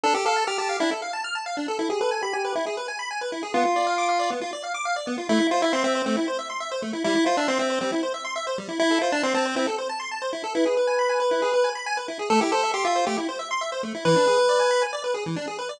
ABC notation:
X:1
M:4/4
L:1/16
Q:1/4=137
K:Am
V:1 name="Lead 1 (square)"
A G A2 G G2 E z8 | A G A2 G G2 E z8 | F8 z8 | E2 F E C C2 C z8 |
E2 F D C C2 C z8 | E2 F D C C2 C z8 | B12 z4 | A G A2 G F2 G z8 |
B8 z8 |]
V:2 name="Lead 1 (square)"
D A f a f' a f D A f a f' a f D A | E ^G B ^g b g B E G B g b g B E G | B, F d f d' f d B, F d f d' f d B, F | A, E c e c' e c A, E c e c' e c A, E |
G, E c e c' e c G, E c e c' e c G, E | E A c a c' a c E A c a c' a c E A | E ^G B ^g b g B E G B g b g B E G | A, E c e c' e c A, E c e c' e c A, E |
E, D ^G B d ^g b g d B G E, D G B d |]